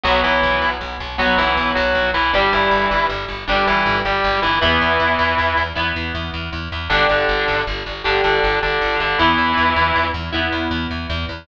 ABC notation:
X:1
M:12/8
L:1/8
Q:3/8=105
K:Em
V:1 name="Distortion Guitar"
[F,F] [E,E]3 z2 [F,F] [E,E]2 [F,F]2 [E,E] | [G,G] [E,E]3 z2 [G,G] [E,E]2 [G,G]2 [E,E] | [E,E]6 z6 | [D,D] [D,D]3 z2 [D,D] [D,D]2 [D,D]2 [D,D] |
[E,E]5 z7 |]
V:2 name="Overdriven Guitar"
[F,B,]6 [F,B,]6 | [G,D]6 [G,D]6 | [B,E]6 [B,E]6 | [DG]6 [DG]6 |
[B,E]6 [B,E]6 |]
V:3 name="Electric Bass (finger)" clef=bass
B,,, B,,, B,,, B,,, B,,, B,,, B,,, B,,, B,,, B,,, B,,, B,,, | G,,, G,,, G,,, G,,, G,,, G,,, G,,, G,,, G,,, G,,, G,,, G,,, | E,, E,, E,, E,, E,, E,, E,, E,, E,, E,, E,, E,, | G,,, G,,, G,,, G,,, G,,, G,,, G,,, G,,, G,,, G,,, G,,, G,,, |
E,, E,, E,, E,, E,, E,, E,, E,, E,, E,, E,, E,, |]